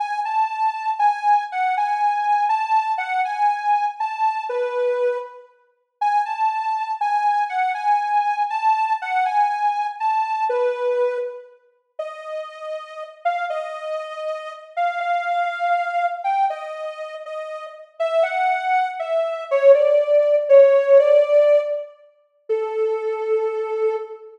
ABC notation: X:1
M:6/8
L:1/8
Q:3/8=80
K:A
V:1 name="Ocarina"
g a3 g2 | f g3 a2 | f g3 a2 | B3 z3 |
g a3 g2 | f g3 a2 | f g3 a2 | B3 z3 |
[K:Bb] e5 f | e5 f | f5 g | e3 e2 z |
[K:A] e f3 e2 | c d3 c2 | d3 z3 | A6 |]